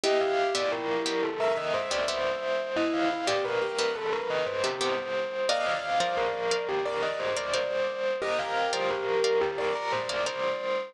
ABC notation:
X:1
M:4/4
L:1/16
Q:1/4=88
K:Cdor
V:1 name="Tubular Bells"
e f2 d B3 A B e c d c4 | e f2 d B3 A B e c G c4 | e f2 c B3 G B e c d c4 | e f2 c B3 G B b c d c4 |]
V:2 name="Acoustic Grand Piano"
[=EG]8 =e8 | =E2 E G =B G B6 z4 | [df]8 d8 | [GB]8 d8 |]
V:3 name="Pizzicato Strings"
[=B,G=e]3 [B,Ge]3 [B,Ge]5 [B,Ge] [B,Ge]4- | [=B,G=e]3 [B,Ge]3 [B,Ge]5 [B,Ge] [B,Ge]4 | [Bdf]3 [Bdf]3 [Bdf]5 [Bdf] [Bdf]4- | [Bdf]3 [Bdf]3 [Bdf]5 [Bdf] [Bdf]4 |]